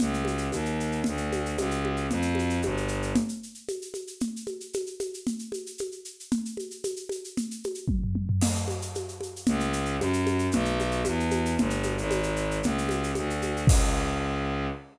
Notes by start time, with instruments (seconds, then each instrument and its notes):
0.00 violin C#2, low conga, shaker
0.14 shaker
0.25 high conga, shaker
0.38 shaker
0.52 violin D#2, high conga, shaker
0.65 shaker
0.80 shaker
0.92 shaker
1.04 violin D2, low conga, shaker
1.17 shaker
1.32 high conga, shaker
1.46 shaker
1.58 violin C#2, high conga, shaker
1.71 shaker
1.85 high conga
1.97 shaker
2.10 violin F2, low conga, shaker
2.22 shaker
2.35 high conga, shaker
2.50 shaker
2.62 violin G1, high conga, shaker
2.77 shaker
2.88 shaker
3.02 shaker
3.15 low conga, shaker
3.29 shaker
3.43 shaker
3.55 shaker
3.68 high conga, shaker
3.82 shaker
3.94 high conga, shaker
4.07 shaker
4.20 low conga, shaker
4.36 shaker
4.47 high conga, shaker
4.60 shaker
4.73 high conga, shaker
4.86 shaker
5.00 high conga, shaker
5.14 shaker
5.27 low conga, shaker
5.39 shaker
5.52 high conga, shaker
5.66 shaker
5.78 high conga, shaker
5.92 shaker
6.05 shaker
6.20 shaker
6.32 low conga, shaker
6.45 shaker
6.57 high conga, shaker
6.71 shaker
6.84 high conga, shaker
6.96 shaker
7.09 high conga, shaker
7.24 shaker
7.37 low conga, shaker
7.51 shaker
7.64 high conga, shaker
7.75 shaker
7.88 kick, high tom
8.04 floor tom
8.15 high tom
8.29 floor tom
8.41 crash, low conga, shaker
8.55 shaker
8.68 high conga, shaker
8.82 shaker
8.95 high conga, shaker
9.08 shaker
9.21 high conga, shaker
9.36 shaker
9.46 violin C#2, low conga, shaker
9.60 shaker
9.73 shaker
9.85 shaker
9.99 violin F#2, high conga, shaker
10.13 shaker
10.27 high conga, shaker
10.39 shaker
10.52 violin B1, low conga, shaker
10.65 shaker
10.80 high conga, shaker
10.92 shaker
11.05 violin E2, high conga, shaker
11.20 shaker
11.31 high conga, shaker
11.46 shaker
11.58 violin G1, low conga, shaker
11.70 shaker
11.83 high conga, shaker
11.97 violin G#1, shaker
12.11 high conga, shaker
12.23 shaker
12.36 shaker
12.51 shaker
12.63 violin C#2, low conga, shaker
12.78 shaker
12.89 high conga, shaker
13.03 shaker
13.15 violin D2, high conga, shaker
13.30 shaker
13.42 high conga, shaker
13.57 shaker
13.67 violin C#2, kick, crash